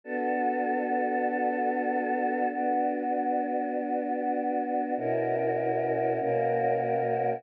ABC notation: X:1
M:3/4
L:1/8
Q:1/4=73
K:Bm
V:1 name="Choir Aahs"
[B,DFA]6 | [B,DF]6 | [B,,CEF^A]3 [B,,^A,CFA]3 |]